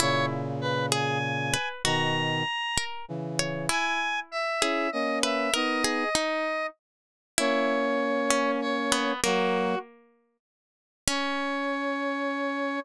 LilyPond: <<
  \new Staff \with { instrumentName = "Lead 1 (square)" } { \time 6/8 \key cis \dorian \tempo 4. = 65 cis''8 r8 b'8 gis''4. | ais''2 r4 | gis''4 e''4 dis''8 e''8 | dis''2 r4 |
cis''2 cis''4 | fis'4 r2 | cis''2. | }
  \new Staff \with { instrumentName = "Harpsichord" } { \time 6/8 \key cis \dorian e'4. gis'8 r8 b'8 | fis'4. ais'8 r8 cis''8 | e'4. gis'8 r8 b'8 | ais'8 gis'8 dis'4 r4 |
e'4. cis'8 r8 b8 | ais2 r4 | cis'2. | }
  \new Staff \with { instrumentName = "Brass Section" } { \time 6/8 \key cis \dorian <ais, cis>2. | <b, dis>4 r4 <cis e>4 | r4. <cis' e'>8 <ais cis'>4 | <b dis'>4 r2 |
<ais cis'>2. | <fis ais>4 r2 | cis'2. | }
>>